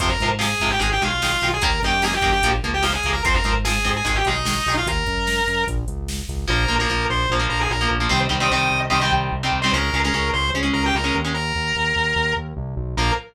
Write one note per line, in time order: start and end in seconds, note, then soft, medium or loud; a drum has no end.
0.00 0.17 F2 medium
0.00 0.09 C3 loud
0.00 0.09 F3 loud
0.00 0.09 C5 loud
0.00 kick medium
0.00 closed hi-hat medium
0.09 0.28 A#4 medium
0.19 0.55 G#2 medium
0.19 0.30 C3 medium
0.19 0.30 F3 medium
0.19 kick medium
0.19 closed hi-hat medium
0.39 0.47 C3 medium
0.39 0.47 F3 medium
0.39 0.71 G#4 medium
0.39 snare medium
0.60 0.78 G#2 medium
0.60 0.69 C3 medium
0.60 0.69 F3 medium
0.60 kick medium
0.60 closed hi-hat medium
0.70 0.80 G4 medium
0.79 0.98 G#1 medium
0.79 0.88 D#3 medium
0.79 0.88 G#3 medium
0.79 0.89 G#4 medium
0.79 kick medium
0.79 closed hi-hat medium
0.92 1.02 G4 medium
1.02 1.36 B1 medium
1.02 1.10 D#3 medium
1.02 1.10 G#3 medium
1.02 1.48 F4 medium
1.02 closed hi-hat medium
1.22 1.31 D#3 medium
1.22 1.31 G#3 medium
1.22 snare medium
1.41 1.59 B1 medium
1.41 1.51 D#3 medium
1.41 1.51 G#3 medium
1.41 closed hi-hat medium
1.54 1.63 G#4 medium
1.62 1.79 D#2 medium
1.62 1.70 D#3 loud
1.62 1.70 A#3 loud
1.62 1.80 A#4 medium
1.62 kick medium
1.62 closed hi-hat medium
1.82 2.17 F#2 medium
1.82 1.92 D#3 medium
1.82 1.92 A#3 medium
1.82 2.02 G4 medium
1.82 kick medium
1.82 closed hi-hat soft
2.02 2.11 D#3 medium
2.02 2.11 A#3 medium
2.02 2.14 G#4 medium
2.02 snare medium
2.13 2.32 G4 medium
2.22 2.40 F#2 medium
2.22 2.30 D#3 medium
2.22 2.30 A#3 medium
2.22 kick medium
2.22 closed hi-hat medium
2.32 2.49 G4 medium
2.42 2.60 A#1 medium
2.42 2.52 F3 loud
2.42 2.52 A#3 medium
2.42 kick medium
2.42 closed hi-hat loud
2.63 2.98 C#2 medium
2.63 2.72 F3 medium
2.63 2.72 A#3 medium
2.63 closed hi-hat medium
2.74 2.84 G4 medium
2.82 2.90 F3 medium
2.82 2.90 A#3 medium
2.82 2.93 F4 medium
2.82 snare medium
2.93 3.10 G#4 medium
3.03 3.21 C#2 medium
3.03 3.14 F3 medium
3.03 3.14 A#3 medium
3.03 kick medium
3.03 closed hi-hat medium
3.13 3.22 A#4 loud
3.24 3.42 F2 medium
3.24 3.33 F3 medium
3.24 3.33 C4 loud
3.24 3.34 C5 medium
3.24 kick loud
3.24 closed hi-hat medium
3.34 3.53 A#4 medium
3.44 3.79 G#2 medium
3.44 3.53 F3 medium
3.44 3.53 C4 medium
3.44 kick medium
3.44 closed hi-hat medium
3.65 3.73 F3 medium
3.65 3.73 C4 medium
3.65 3.90 G#4 medium
3.65 snare loud
3.84 4.02 G#2 medium
3.84 3.93 F3 medium
3.84 3.93 C4 medium
3.84 kick medium
3.84 closed hi-hat medium
3.96 4.06 G#4 medium
4.05 4.23 G#1 medium
4.05 4.13 D#3 medium
4.05 4.13 G#3 medium
4.05 4.16 G#4 medium
4.05 kick medium
4.05 closed hi-hat medium
4.15 4.25 G4 medium
4.25 4.60 B1 medium
4.25 4.35 D#3 medium
4.25 4.35 G#3 medium
4.25 4.74 D#4 loud
4.25 closed hi-hat medium
4.45 4.53 D#3 medium
4.45 4.53 G#3 medium
4.45 snare loud
4.66 4.84 B1 medium
4.66 4.76 D#3 medium
4.66 4.76 G#3 medium
4.66 open hi-hat medium
4.77 4.87 F4 medium
4.86 5.04 D#2 medium
4.86 5.63 A#4 medium
4.86 kick medium
4.86 closed hi-hat medium
5.06 5.41 F#2 medium
5.06 kick medium
5.06 closed hi-hat medium
5.27 snare medium
5.47 5.65 F#2 medium
5.47 closed hi-hat medium
5.67 5.85 A#1 medium
5.67 kick medium
5.67 closed hi-hat medium
5.88 6.22 C#2 medium
5.88 closed hi-hat medium
6.08 snare medium
6.28 6.46 C#2 medium
6.28 kick medium
6.28 closed hi-hat medium
6.47 6.66 A#1 loud
6.47 6.64 F3 loud
6.47 6.64 A#3 loud
6.47 6.75 A#4 loud
6.68 6.86 A#1 medium
6.68 6.76 F3 medium
6.68 6.76 A#3 medium
6.79 6.88 F3 medium
6.79 6.88 A#3 medium
6.79 7.05 A#4 medium
6.89 7.06 A#1 medium
6.89 7.22 F3 medium
6.89 7.22 A#3 medium
7.09 7.27 A#1 medium
7.09 7.30 C5 medium
7.30 7.47 A#1 medium
7.30 7.39 F3 medium
7.30 7.39 A#3 medium
7.39 7.72 F3 medium
7.39 7.72 A#3 medium
7.50 7.67 A#1 medium
7.50 7.59 A#4 medium
7.61 7.70 G#4 medium
7.70 7.88 A#1 medium
7.70 7.88 A#4 medium
7.81 7.97 F3 loud
7.81 7.97 A#3 medium
7.91 8.08 A#1 medium
8.00 8.08 F3 medium
8.00 8.08 A#3 medium
8.09 8.28 C2 medium
8.09 8.26 D#3 loud
8.09 8.26 G3 loud
8.09 8.26 C4 loud
8.09 8.19 C5 loud
8.29 8.48 C2 medium
8.29 8.37 D#3 medium
8.29 8.37 G3 medium
8.29 8.37 C4 medium
8.40 8.48 D#3 loud
8.40 8.48 G3 loud
8.40 8.48 C4 medium
8.40 8.51 D#5 loud
8.51 8.68 C2 medium
8.51 8.84 D#3 medium
8.51 8.84 G3 medium
8.51 8.84 C4 medium
8.51 8.80 D#5 medium
8.72 8.89 C2 medium
8.90 9.09 C2 medium
8.90 8.98 D#3 loud
8.90 8.98 G3 medium
8.90 8.98 C4 loud
8.90 9.00 D#5 medium
9.01 9.34 D#3 medium
9.01 9.34 G3 medium
9.01 9.34 C4 medium
9.01 9.12 G5 medium
9.12 9.29 C2 medium
9.32 9.50 C2 medium
9.43 9.59 D#3 medium
9.43 9.59 G3 medium
9.43 9.59 C4 medium
9.53 9.70 C2 medium
9.62 9.72 D#3 loud
9.62 9.72 G3 loud
9.62 9.72 C4 medium
9.62 9.71 C5 medium
9.73 9.90 C#2 medium
9.73 9.90 G#3 loud
9.73 9.90 C#4 loud
9.73 9.99 A#4 loud
9.93 10.11 C#2 medium
9.93 10.02 G#3 medium
9.93 10.02 C#4 medium
10.04 10.13 G#3 loud
10.04 10.13 C#4 medium
10.04 10.29 A#4 medium
10.13 10.31 C#2 medium
10.13 10.46 G#3 medium
10.13 10.46 C#4 medium
10.33 10.51 C#2 medium
10.33 10.50 C5 medium
10.54 10.71 C#2 medium
10.54 10.62 G#3 medium
10.54 10.62 C#4 loud
10.63 10.95 G#3 medium
10.63 10.95 C#4 medium
10.73 10.92 C#2 medium
10.73 10.83 A#4 loud
10.86 10.95 G4 medium
10.95 11.12 C#2 medium
10.95 11.15 A#4 medium
11.04 11.20 G#3 medium
11.04 11.20 C#4 medium
11.15 11.52 D#2 medium
11.25 11.33 G#3 medium
11.25 11.33 C#4 medium
11.34 12.33 A#4 medium
11.55 11.73 D#2 medium
11.76 11.93 D#2 medium
11.96 12.13 D#2 medium
12.16 12.33 D#2 medium
12.37 12.54 D#2 medium
12.57 12.75 C2 medium
12.77 12.95 B1 medium
12.97 13.11 A#1 loud
12.97 13.12 F3 medium
12.97 13.12 A#3 loud
12.97 13.11 A#4 loud